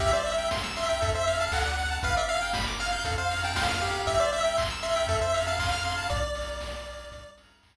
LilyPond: <<
  \new Staff \with { instrumentName = "Lead 1 (square)" } { \time 4/4 \key c \major \tempo 4 = 118 e''16 d''16 e''8 r8 e''8. e''8 f''16 fis''4 | f''16 e''16 f''8 r8 f''8. f''8 g''16 f''4 | e''16 d''16 e''8 r8 e''8. e''8 f''16 f''4 | d''2~ d''8 r4. | }
  \new Staff \with { instrumentName = "Lead 1 (square)" } { \time 4/4 \key c \major g'16 c''16 e''16 g''16 c'''16 e'''16 c'''16 g''16 a'16 c''16 f''16 a''16 a'16 d''16 fis''16 a''16 | b'16 d''16 f''16 g''16 b''16 d'''16 f'''16 g'''16 a'16 c''16 f''16 a''16 c'''16 f'''16 g'8~ | g'16 c''16 e''16 g''16 c'''16 e'''16 c'''16 g''16 a'16 c''16 f''16 a''16 c'''16 f'''16 c'''16 a''16 | r1 | }
  \new Staff \with { instrumentName = "Synth Bass 1" } { \clef bass \time 4/4 \key c \major c,2 f,4 d,4 | g,,2 f,2 | c,2 f,2 | b,,2 c,2 | }
  \new DrumStaff \with { instrumentName = "Drums" } \drummode { \time 4/4 <hh bd>8 hho8 <bd sn>8 hho8 <hh bd>8 hho8 <hc bd>8 hho8 | <hh bd>8 hho8 <bd sn>8 hho8 <hh bd>8 hho8 <bd sn>8 hho8 | <hh bd>8 hho8 <hc bd>8 hho8 <hh bd>8 hho8 <hc bd>8 hho8 | <hh bd>8 hho8 <bd sn>8 hho8 <hh bd>8 hho8 <hc bd>4 | }
>>